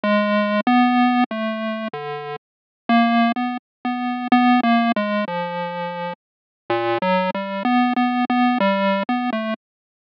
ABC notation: X:1
M:7/8
L:1/16
Q:1/4=63
K:none
V:1 name="Lead 1 (square)"
(3_A,4 B,4 =A,4 D,2 z2 _B,2 | B, z B,2 (3B,2 _B,2 _A,2 F,4 z2 | (3_B,,2 _G,2 =G,2 (3=B,2 B,2 B,2 G,2 B, A, z2 |]